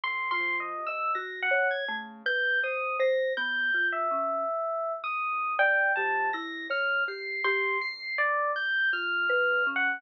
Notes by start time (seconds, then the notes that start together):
0.03 D3 C6
0.31 F4 C6
0.39 F3
0.60 D#5
0.76 C3
0.87 D#5 E6
1.15 G#2 F#4 A#6
1.42 F#5
1.51 B2 C#5
1.71 G#6
1.88 C#3 A3
2.26 B4 G6
2.55 E2
2.63 C5 D#6
2.99 C5 A#6
3.37 F3 B3 G6
3.74 F4
3.92 C3 E5
4.11 C#4
4.77 D#2
5.04 D#6
5.31 G#2
5.58 A#2 D5 G5
5.96 F3 G4 A5
6.33 C3 E4 A#6
6.69 A2 C#5 F6
7.08 G4 C7
7.44 B2 G4 C6
7.81 C7
8.17 G#2 D5
8.56 G6
8.91 D#2 F4 F6
9.21 A#2
9.29 B4
9.49 C#3
9.67 C#4
9.76 F#5